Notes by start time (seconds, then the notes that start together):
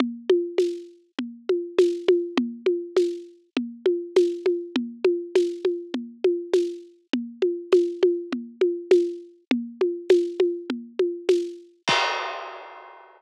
0.00 low conga
0.30 high conga
0.58 tambourine, high conga
1.19 low conga
1.49 high conga
1.78 tambourine, high conga
2.08 high conga
2.37 low conga
2.66 high conga
2.97 tambourine, high conga
3.57 low conga
3.86 high conga
4.16 tambourine, high conga
4.46 high conga
4.76 low conga
5.04 high conga
5.35 tambourine, high conga
5.65 high conga
5.94 low conga
6.24 high conga
6.53 tambourine, high conga
7.13 low conga
7.42 high conga
7.72 tambourine, high conga
8.03 high conga
8.33 low conga
8.61 high conga
8.91 tambourine, high conga
9.51 low conga
9.81 high conga
10.10 tambourine, high conga
10.40 high conga
10.70 low conga
10.99 high conga
11.29 tambourine, high conga
11.88 kick, crash